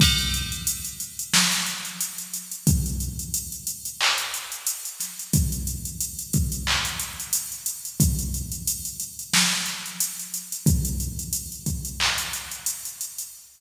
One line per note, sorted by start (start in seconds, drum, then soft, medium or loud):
0.00 kick loud
0.00 crash loud
0.18 closed hi-hat medium
0.34 closed hi-hat medium
0.52 closed hi-hat medium
0.67 closed hi-hat loud
0.85 closed hi-hat medium
1.00 closed hi-hat medium
1.19 closed hi-hat medium
1.33 snare loud
1.52 snare soft
1.52 closed hi-hat medium
1.66 closed hi-hat medium
1.85 closed hi-hat medium
2.01 closed hi-hat loud
2.18 closed hi-hat medium
2.34 closed hi-hat medium
2.52 closed hi-hat medium
2.67 kick loud
2.67 closed hi-hat loud
2.86 closed hi-hat medium
3.00 closed hi-hat medium
3.19 closed hi-hat medium
3.34 closed hi-hat loud
3.52 closed hi-hat medium
3.67 closed hi-hat medium
3.85 closed hi-hat medium
4.01 clap loud
4.18 closed hi-hat medium
4.34 closed hi-hat medium
4.52 closed hi-hat medium
4.67 closed hi-hat loud
4.85 closed hi-hat medium
5.00 snare soft
5.00 closed hi-hat medium
5.19 closed hi-hat medium
5.33 kick loud
5.33 closed hi-hat loud
5.52 closed hi-hat medium
5.67 closed hi-hat medium
5.85 closed hi-hat medium
6.01 closed hi-hat loud
6.19 closed hi-hat medium
6.33 kick medium
6.33 closed hi-hat medium
6.52 closed hi-hat medium
6.67 clap loud
6.85 closed hi-hat medium
6.99 closed hi-hat medium
7.20 closed hi-hat medium
7.33 closed hi-hat loud
7.52 closed hi-hat medium
7.66 closed hi-hat loud
7.85 closed hi-hat medium
8.00 kick loud
8.00 closed hi-hat loud
8.19 closed hi-hat medium
8.34 closed hi-hat medium
8.52 closed hi-hat medium
8.67 closed hi-hat loud
8.85 closed hi-hat medium
9.00 closed hi-hat medium
9.19 closed hi-hat medium
9.33 snare loud
9.66 closed hi-hat medium
9.86 closed hi-hat medium
10.00 closed hi-hat loud
10.19 closed hi-hat medium
10.34 closed hi-hat medium
10.52 closed hi-hat medium
10.66 kick loud
10.66 closed hi-hat loud
10.85 closed hi-hat medium
11.00 closed hi-hat medium
11.19 closed hi-hat medium
11.33 closed hi-hat loud
11.52 closed hi-hat medium
11.66 kick medium
11.66 closed hi-hat medium
11.85 closed hi-hat medium
12.00 clap loud
12.18 closed hi-hat medium
12.33 closed hi-hat medium
12.51 closed hi-hat medium
12.66 closed hi-hat loud
12.85 closed hi-hat medium
13.01 closed hi-hat medium
13.18 closed hi-hat medium